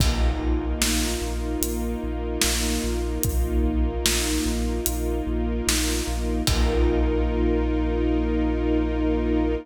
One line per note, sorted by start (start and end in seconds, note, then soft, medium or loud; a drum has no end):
0.00 0.33 A#1 loud
0.00 6.42 A#3 medium
0.00 0.80 D#4 medium
0.00 6.42 D#4 medium
0.00 6.42 F4 medium
0.00 kick loud
0.00 crash loud
0.40 0.74 A#1 medium
0.40 2.02 A#4 medium
0.81 1.15 A#1 medium
0.81 1.63 D#4 medium
0.81 snare loud
1.21 1.56 A#1 medium
1.21 2.44 F4 medium
1.61 1.96 A#1 medium
1.61 2.84 D#4 medium
1.61 closed hi-hat loud
2.03 2.38 A#1 medium
2.03 3.63 A#4 medium
2.42 2.78 A#1 medium
2.42 4.47 F4 medium
2.42 snare loud
2.84 3.18 A#1 medium
2.84 3.24 D#4 medium
3.23 3.59 A#1 medium
3.23 4.05 D#4 medium
3.23 kick loud
3.23 closed hi-hat loud
3.64 3.98 A#1 medium
3.64 5.27 A#4 medium
4.05 4.39 A#1 medium
4.05 4.86 D#4 medium
4.05 snare loud
4.46 4.80 A#1 medium
4.46 5.66 F4 medium
4.86 5.21 A#1 medium
4.86 6.08 D#4 medium
4.86 closed hi-hat loud
5.27 5.61 A#1 medium
5.27 6.43 A#4 medium
5.67 6.02 A#1 medium
5.67 6.44 F4 medium
5.67 snare loud
6.07 6.42 A#1 medium
6.07 6.47 D#4 medium
6.47 9.56 A#1 loud
6.47 9.55 A#3 medium
6.47 9.55 D#4 loud
6.47 9.55 F4 medium
6.47 9.55 F4 loud
6.47 9.55 A#4 loud
6.47 kick loud
6.47 crash loud